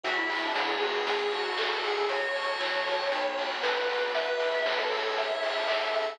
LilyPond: <<
  \new Staff \with { instrumentName = "Distortion Guitar" } { \time 4/4 \key fis \minor \tempo 4 = 117 fis'16 e'16 e'16 d'16 e'16 gis'16 fis'16 gis'8. fis'4 gis'8 | cis''2. b'4 | b'8. r16 b'16 a'8. e''4 e''16 e''16 e''8 | }
  \new Staff \with { instrumentName = "Lead 1 (square)" } { \time 4/4 \key fis \minor e''4 cis''2 a'4 | fis'4. r2 r8 | e''4 cis''2 a'4 | }
  \new Staff \with { instrumentName = "Tubular Bells" } { \time 4/4 \key fis \minor b'8 e''8 fis''8 gis''8 cis''8 a''8 cis''8 gis''8 | cis''8 a''8 cis''8 fis''8 b'8 fis''8 b'8 d''8 | b'8 e''8 fis''8 gis''8 cis''8 a''8 cis''8 gis''8 | }
  \new Staff \with { instrumentName = "Electric Bass (finger)" } { \clef bass \time 4/4 \key fis \minor e,4 d4 a,,4 g,4 | fis,4 e4 b,,4 a,4 | r1 | }
  \new Staff \with { instrumentName = "Pad 5 (bowed)" } { \time 4/4 \key fis \minor <b e' fis' gis'>2 <cis' e' gis' a'>2 | <cis' fis' a'>2 <b d' fis'>2 | <b e' fis' gis'>2 <cis' e' gis' a'>2 | }
  \new DrumStaff \with { instrumentName = "Drums" } \drummode { \time 4/4 <hh bd>8 hho8 <bd sn>8 hho8 <hh bd>8 hho8 <hc bd>8 hho8 | <hh bd>8 hho8 <hc bd>8 hho8 <hh bd>8 hho8 <bd sn>8 hho8 | <hh bd>8 hho8 <bd sn>8 hho8 <hh bd>8 hho8 <hc bd>8 hho8 | }
>>